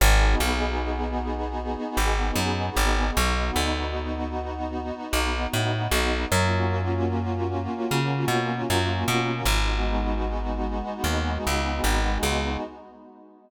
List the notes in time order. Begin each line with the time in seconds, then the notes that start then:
0.00 G#1 B3 D#4 F#4 G#4
0.40 B1
1.97 G#1
2.36 F#2
2.76 G#1
3.16 B1 B3 D#4 F#4
3.56 D2
5.13 B1
5.53 A2
5.91 B1
6.32 F#2 A#3 C#4 F4 F#4
7.91 C#3
8.28 B2
8.70 F#2
9.08 B2
9.45 G#1 G#3 B3 D#4 F#4
11.04 D#2
11.47 C#2
11.84 G#1
12.23 C#2